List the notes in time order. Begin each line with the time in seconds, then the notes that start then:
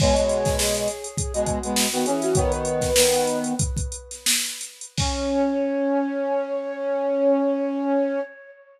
0.00 B2 G#3 C#5, kick, crash
0.16 B2 G#3, closed hi-hat
0.29 closed hi-hat
0.45 kick, snare, closed hi-hat
0.58 G#4, snare
0.75 closed hi-hat
0.88 closed hi-hat
1.04 closed hi-hat
1.17 G#4, kick, closed hi-hat
1.34 B2 G#3 F#4, closed hi-hat
1.46 kick, closed hi-hat
1.63 B2 G#3, closed hi-hat
1.76 snare
1.92 D#3 B3 F#4, snare, closed hi-hat
2.05 E3 C#4 G#4, closed hi-hat
2.22 F#4, snare, closed hi-hat
2.35 D#3 B3 C#5, kick, closed hi-hat
2.51 B4, closed hi-hat
2.65 closed hi-hat
2.81 kick, snare, closed hi-hat
2.96 D#3 B3, snare
3.13 closed hi-hat
3.27 closed hi-hat
3.44 closed hi-hat
3.59 kick, closed hi-hat
3.77 kick, closed hi-hat
3.92 closed hi-hat
4.11 snare, closed hi-hat
4.26 snare
4.46 closed hi-hat
4.61 closed hi-hat
4.81 closed hi-hat
4.98 C#4 C#5, kick, crash